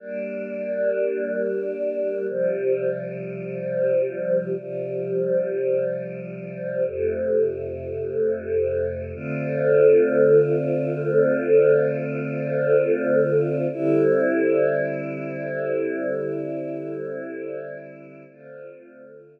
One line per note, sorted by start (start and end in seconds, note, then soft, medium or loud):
0.00 2.26 G3 medium
0.00 2.26 A#3 medium
0.00 2.26 D4 medium
2.29 4.55 C3 medium
2.29 4.55 F3 medium
2.29 4.55 G3 medium
4.57 6.83 C3 medium
4.57 6.83 F3 medium
4.57 6.83 G3 medium
6.86 9.12 F2 medium
6.86 9.12 C3 medium
6.86 9.12 A3 medium
9.14 13.67 D3 medium
9.14 13.67 A3 medium
9.14 13.67 C4 medium
9.14 13.67 F4 medium
13.72 18.24 D3 medium
13.72 18.24 G3 medium
13.72 18.24 C4 medium
13.72 18.24 E4 medium
18.29 19.40 D3 medium
18.29 19.40 A3 medium
18.29 19.40 C4 loud
18.29 19.40 F4 medium